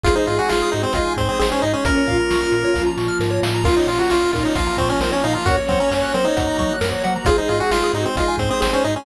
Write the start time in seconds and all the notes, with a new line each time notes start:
0.03 G#1 G#3 C4 D#4 F4 G#4, kick, closed hi-hat
0.15 D#4 C5
0.26 G#2 F4 D#5, closed hi-hat
0.38 F#4 G#5
0.49 G#1 F4 C6, snare
0.62 D#6
0.72 G#2 D#4 F#4 G#4, closed hi-hat
0.82 C4 C5
0.93 G#1 G#3 D#4 F4 G#4 D#5, kick, closed hi-hat
1.05 G#5
1.17 G#2 C4 C6, kick, closed hi-hat
1.28 C4 D#6
1.39 G#1 C4 G#4, snare
1.52 C#4 C5
1.62 G#2 D#4 D#5, closed hi-hat
1.73 C#4 G#5
1.85 A#1 A#3 C#4 F4 A#4, kick, closed hi-hat
1.98 C#5
2.06 A#2 F4 F5, kick, closed hi-hat
2.20 A#5
2.30 A#1 C#6, snare
2.41 F6
2.52 A#2 A#4, closed hi-hat
2.64 C#5
2.74 A#1 F3 A#3 F4 F5, kick, snare
2.86 A#5
2.97 A#2 C#6, snare
3.08 F6
3.20 G#2 A#4, snare
3.30 C#5
3.43 A2 F5, snare
3.54 A#5
3.64 A#1 A#3 C#4 F4 A#4, kick, crash
3.77 D#4 C#5
3.87 A#2 F4 F5, closed hi-hat
3.98 F#4 A#5
4.10 A#1 F4 C#6, snare
4.21 F6
4.33 A#2 D#4 F4 A#4, kick, closed hi-hat
4.44 D#4 C#5
4.55 A#1 F3 A#3 F4 F5, kick, closed hi-hat
4.67 A#5
4.77 A#2 C4 C#6, kick, closed hi-hat
4.89 C#4 F6
5.00 A#1 C4 A#4, snare
5.12 C#4 C#5
5.23 A#2 D#4 F5, closed hi-hat
5.33 F4 A#5
5.45 F#2 A#3 C#4 F#4 A#4 C#5, kick, closed hi-hat
5.57 C#5
5.68 F#3 C4 F#5, kick, closed hi-hat
5.80 C#4 A#5
5.90 F#2 C#4 C#6, snare
6.02 F#6
6.14 F#3 C4 A#4 C5, closed hi-hat
6.25 D#4 C#5
6.36 F#2 F#3 A#3 F#4 F#5, kick, closed hi-hat
6.47 A#5
6.58 F#3 C#6, kick, closed hi-hat
6.69 F#6
6.81 F#2 A#4, snare
6.92 C#5
7.04 F#3 F#5, closed hi-hat
7.16 A#5
7.25 G#1 G#3 C4 D#4 F4 G#4, kick, closed hi-hat
7.37 D#4 C5
7.48 G#2 F4 D#5, closed hi-hat
7.60 F#4 G#5
7.71 G#1 F4 C6, snare
7.84 D#6
7.93 G#2 D#4 F#4 G#4, closed hi-hat
8.05 C4 C5
8.16 G#1 G#3 D#4 F4 G#4 D#5, kick, closed hi-hat
8.28 G#5
8.38 G#2 C4 C6, kick, closed hi-hat
8.50 C4 D#6
8.60 G#1 C4 G#4, snare
8.73 C#4 C5
8.84 G#2 D#4 D#5, closed hi-hat
8.96 C#4 G#5